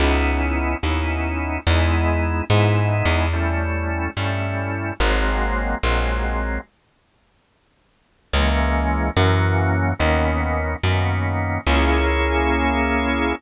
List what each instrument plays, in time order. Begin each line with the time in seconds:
0.00 electric bass (finger) C#2, drawbar organ B3 C#4 D#4 E4
0.83 electric bass (finger) D#2, drawbar organ B3 C#4 D#4 E4
1.67 electric bass (finger) E2, drawbar organ G#3 B3 D#4 E4
2.50 electric bass (finger) G#2, drawbar organ G#3 B3 D#4 E4
3.05 electric bass (finger) E2
3.33 drawbar organ G3 A3 C#4 E4
4.17 electric bass (finger) G2, drawbar organ G3 A3 C#4 E4
5.00 electric bass (finger) G#1, drawbar organ F#3 G#3 A#3 C4
5.83 electric bass (finger) A#1, drawbar organ F#3 G#3 A#3 C4
8.33 electric bass (finger) C#2, drawbar organ E3 G#3 A#3 C#4
9.17 electric bass (finger) F#2, drawbar organ E3 F#3 A#3 C#4
9.99 electric bass (finger) D#2, drawbar organ D#3 A#3 B3 C#4
10.83 electric bass (finger) F#2, drawbar organ D#3 A#3 B3 C#4
11.67 electric bass (finger) C#2, drawbar organ A#3 C#4 E4 G#4